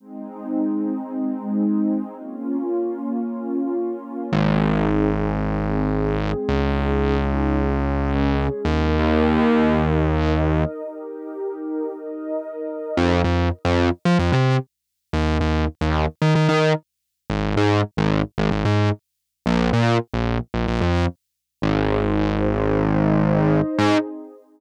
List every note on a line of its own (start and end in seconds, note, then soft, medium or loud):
0.00 2.14 G#3 medium
0.00 2.14 C4 medium
0.00 2.14 D#4 medium
2.16 4.30 A#3 medium
2.16 4.30 C#4 medium
2.16 4.30 F4 medium
4.32 6.31 G#1 medium
4.32 5.40 C4 medium
4.32 5.40 D#4 medium
4.32 5.40 G#4 medium
5.41 6.48 G#3 medium
5.41 6.48 C4 medium
5.41 6.48 G#4 medium
6.49 8.48 C#2 medium
6.49 7.56 C#4 medium
6.49 7.56 D#4 medium
6.49 7.56 G#4 medium
7.57 8.64 G#3 medium
7.57 8.64 C#4 medium
7.57 8.64 G#4 medium
8.65 10.64 D#2 medium
8.65 9.72 D#4 medium
8.65 9.72 G4 medium
8.65 9.72 A#4 medium
9.73 10.80 D#4 medium
9.73 10.80 A#4 medium
9.73 10.80 D#5 medium
10.81 11.88 D#4 medium
10.81 11.88 G4 medium
10.81 11.88 A#4 medium
11.89 12.96 D#4 medium
11.89 12.96 A#4 medium
11.89 12.96 D#5 medium
12.97 13.22 F2 medium
13.24 13.49 F2 medium
13.65 13.89 F2 medium
14.05 14.17 F3 medium
14.19 14.31 F2 loud
14.32 14.57 C3 medium
15.13 15.38 D#2 loud
15.41 15.65 D#2 medium
15.81 16.06 D#2 medium
16.22 16.34 D#3 medium
16.35 16.47 D#3 medium
16.48 16.73 D#3 medium
17.30 17.54 G#1 loud
17.57 17.81 G#2 medium
17.97 18.22 G#1 medium
18.38 18.50 G#1 medium
18.51 18.63 G#1 medium
18.65 18.89 G#2 medium
19.46 19.70 A#1 loud
19.73 19.97 A#2 medium
20.14 20.38 A#1 medium
20.54 20.66 A#1 medium
20.68 20.80 A#1 medium
20.81 21.06 F2 medium
21.62 23.61 G#1 medium
21.62 22.69 D#4 medium
21.62 22.69 G#4 medium
21.62 22.69 C5 medium
22.70 23.77 D#4 medium
22.70 23.77 C5 medium
22.70 23.77 D#5 medium
23.78 23.97 G#2 loud
23.78 23.97 C4 loud
23.78 23.97 D#4 loud
23.78 23.97 G#4 medium